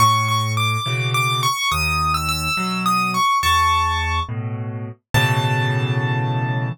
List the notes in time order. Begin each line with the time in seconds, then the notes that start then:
0.00 A2 C#6
0.28 C#6
0.57 D6
0.86 B2 C#3 E3
1.14 D6
1.43 C#6
1.71 D#2 D#6
2.14 E6
2.29 E6
2.57 B2 F#3
2.86 D#6
3.14 C#6
3.43 E2 A5 C#6
4.29 A2 B2
5.14 A2 B2 C#3 E3 A5